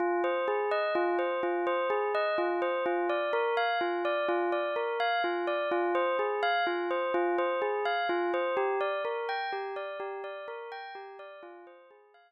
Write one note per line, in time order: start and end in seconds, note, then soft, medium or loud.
0.00 0.22 F4 loud
0.24 0.46 C5 medium
0.48 0.70 G#4 medium
0.71 0.93 D#5 medium
0.95 1.17 F4 loud
1.19 1.41 C5 medium
1.43 1.65 F4 medium
1.67 1.89 C5 medium
1.90 2.12 G#4 medium
2.15 2.37 D#5 medium
2.38 2.60 F4 medium
2.62 2.84 C5 medium
2.86 3.08 F4 medium
3.09 3.31 D5 medium
3.33 3.55 A#4 medium
3.57 3.79 F5 medium
3.81 4.03 F4 medium
4.05 4.27 D5 medium
4.28 4.50 F4 medium
4.52 4.74 D5 medium
4.76 4.98 A#4 medium
5.00 5.22 F5 medium
5.24 5.46 F4 medium
5.47 5.69 D5 medium
5.71 5.93 F4 medium
5.95 6.17 C5 medium
6.19 6.41 G#4 medium
6.43 6.65 F5 loud
6.67 6.89 F4 medium
6.91 7.12 C5 medium
7.14 7.36 F4 loud
7.38 7.60 C5 medium
7.62 7.84 G#4 medium
7.85 8.07 F5 medium
8.09 8.31 F4 medium
8.34 8.56 C5 medium
8.57 8.79 G4 medium
8.81 9.02 D5 medium
9.05 9.27 A#4 medium
9.29 9.51 G5 medium
9.52 9.74 G4 medium
9.76 9.98 D5 medium
10.00 10.22 G4 medium
10.24 10.46 D5 medium
10.48 10.70 A#4 medium
10.72 10.94 G5 medium
10.95 11.17 G4 medium
11.19 11.41 D5 medium
11.43 11.65 F4 loud
11.67 11.89 C5 medium
11.91 12.12 G#4 medium
12.14 12.32 F5 loud